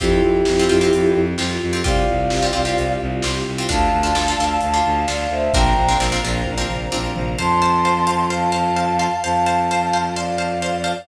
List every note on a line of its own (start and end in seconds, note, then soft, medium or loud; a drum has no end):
0.00 0.20 F2 loud
0.00 0.36 C4 medium
0.00 1.83 C4 medium
0.00 1.18 E4 loud
0.00 0.36 F4 medium
0.00 1.83 F4 medium
0.00 0.36 G4 medium
0.00 1.18 G4 loud
0.00 1.83 G4 medium
0.00 kick loud
0.00 closed hi-hat medium
0.22 0.41 F2 medium
0.45 0.66 F2 medium
0.45 snare loud
0.59 0.69 C4 medium
0.59 0.69 F4 medium
0.59 0.69 G4 medium
0.69 0.89 F2 medium
0.69 0.79 C4 medium
0.69 0.79 F4 medium
0.69 0.79 G4 medium
0.81 1.18 C4 medium
0.81 1.18 F4 medium
0.81 1.18 G4 medium
0.93 1.13 F2 medium
0.93 closed hi-hat loud
1.14 1.34 F2 medium
1.38 1.57 F2 medium
1.38 1.66 C4 medium
1.38 1.66 F4 medium
1.38 1.66 G4 medium
1.38 snare loud
1.62 1.82 F2 medium
1.73 1.82 C4 medium
1.73 1.82 F4 medium
1.73 1.82 G4 medium
1.84 2.04 C2 loud
1.84 2.21 C4 medium
1.84 3.68 C4 medium
1.84 2.21 F4 medium
1.84 3.68 F4 medium
1.84 2.21 G4 medium
1.84 3.68 G4 medium
1.84 2.99 D5 medium
1.84 2.99 F5 medium
1.84 kick loud
1.84 closed hi-hat medium
2.09 2.29 C2 medium
2.30 2.50 C2 medium
2.30 snare loud
2.42 2.52 C4 medium
2.42 2.52 F4 medium
2.42 2.52 G4 medium
2.53 2.74 C2 medium
2.53 2.62 C4 medium
2.53 2.62 F4 medium
2.53 2.62 G4 medium
2.65 3.02 C4 medium
2.65 3.02 F4 medium
2.65 3.02 G4 medium
2.77 2.97 C2 medium
2.77 closed hi-hat loud
3.01 3.21 C2 medium
3.22 3.43 C2 medium
3.22 3.51 C4 medium
3.22 3.51 F4 medium
3.22 3.51 G4 medium
3.22 snare loud
3.47 3.67 C2 medium
3.58 3.68 C4 medium
3.58 3.68 F4 medium
3.58 3.68 G4 medium
3.69 3.90 D2 loud
3.69 3.97 D4 medium
3.69 3.97 F4 medium
3.69 3.97 A4 medium
3.69 5.52 D5 medium
3.69 5.52 F5 medium
3.69 4.60 F5 medium
3.69 5.52 A5 medium
3.69 4.60 A5 loud
3.69 kick loud
3.69 closed hi-hat loud
3.93 4.12 D2 medium
4.03 4.12 D4 medium
4.03 4.12 F4 medium
4.03 4.12 A4 medium
4.14 4.34 D2 medium
4.14 4.24 D4 medium
4.14 4.24 F4 medium
4.14 4.24 A4 medium
4.14 snare loud
4.28 4.37 D4 medium
4.28 4.37 F4 medium
4.28 4.37 A4 medium
4.38 4.58 D2 medium
4.38 4.68 D4 medium
4.38 4.68 F4 medium
4.38 4.68 A4 medium
4.61 4.81 D2 medium
4.61 5.00 F5 medium
4.61 5.00 A5 medium
4.61 closed hi-hat loud
4.74 5.01 D4 medium
4.74 5.01 F4 medium
4.74 5.01 A4 medium
4.86 5.05 D2 medium
5.07 5.27 D2 medium
5.07 5.45 D4 medium
5.07 5.45 F4 medium
5.07 5.45 A4 medium
5.07 5.30 D5 medium
5.07 5.30 F5 medium
5.07 snare loud
5.29 5.49 D2 medium
5.29 5.52 C5 medium
5.29 5.52 E5 medium
5.53 5.73 A#1 loud
5.53 5.82 C4 medium
5.53 5.82 D4 medium
5.53 5.82 F4 medium
5.53 5.82 A#4 medium
5.53 7.36 C5 medium
5.53 7.36 D5 medium
5.53 7.36 F5 medium
5.53 5.97 G5 medium
5.53 5.97 A#5 medium
5.53 7.36 A#5 medium
5.53 kick loud
5.53 closed hi-hat loud
5.75 5.95 A#1 medium
5.88 5.98 C4 medium
5.88 5.98 D4 medium
5.88 5.98 F4 medium
5.88 5.98 A#4 medium
5.99 6.18 A#1 medium
5.99 6.09 C4 medium
5.99 6.09 D4 medium
5.99 6.09 F4 medium
5.99 6.09 A#4 medium
5.99 snare loud
6.12 6.21 C4 medium
6.12 6.21 D4 medium
6.12 6.21 F4 medium
6.12 6.21 A#4 medium
6.23 6.42 A#1 loud
6.23 6.52 C4 medium
6.23 6.52 D4 medium
6.23 6.52 F4 medium
6.23 6.52 A#4 medium
6.46 6.66 A#1 medium
6.46 kick medium
6.46 high tom medium
6.58 6.85 C4 medium
6.58 6.85 D4 medium
6.58 6.85 F4 medium
6.58 6.85 A#4 medium
6.68 6.87 A#1 medium
6.68 floor tom medium
6.92 7.13 A#1 medium
6.92 7.29 C4 medium
6.92 7.29 D4 medium
6.92 7.29 F4 medium
6.92 7.29 A#4 medium
6.92 high tom medium
7.15 7.35 A#1 medium
7.15 floor tom loud
7.38 9.08 F2 medium
7.38 7.48 C5 medium
7.38 7.48 F5 medium
7.38 7.48 A5 medium
7.38 8.23 A5 medium
7.38 8.23 C6 loud
7.62 7.71 C5 medium
7.62 7.71 F5 medium
7.62 7.71 A5 medium
7.85 7.94 C5 medium
7.85 7.94 F5 medium
7.85 7.94 A5 medium
8.07 8.16 C5 medium
8.07 8.16 F5 medium
8.07 8.16 A5 medium
8.30 8.40 C5 medium
8.30 8.40 F5 medium
8.30 9.17 F5 medium
8.30 8.40 A5 medium
8.30 9.17 A5 medium
8.52 8.61 C5 medium
8.52 8.61 F5 medium
8.52 8.61 A5 medium
8.76 8.86 C5 medium
8.76 8.86 F5 medium
8.76 8.86 A5 medium
8.99 9.09 C5 medium
8.99 9.09 F5 medium
8.99 9.09 A5 medium
9.23 10.94 F2 medium
9.23 9.33 C5 medium
9.23 10.04 F5 medium
9.23 9.33 F5 medium
9.23 10.04 A5 loud
9.23 9.33 A5 medium
9.46 9.56 C5 medium
9.46 9.56 F5 medium
9.46 9.56 A5 medium
9.71 9.80 C5 medium
9.71 9.80 F5 medium
9.71 9.80 A5 medium
9.93 10.03 C5 medium
9.93 10.03 F5 medium
9.93 10.03 A5 medium
10.15 10.26 C5 medium
10.15 11.01 D5 medium
10.15 11.01 F5 medium
10.15 10.26 F5 medium
10.15 10.26 A5 medium
10.38 10.47 C5 medium
10.38 10.47 F5 medium
10.38 10.47 A5 medium
10.62 10.71 C5 medium
10.62 10.71 F5 medium
10.62 10.71 A5 medium
10.84 10.93 C5 medium
10.84 10.93 F5 medium
10.84 10.93 A5 medium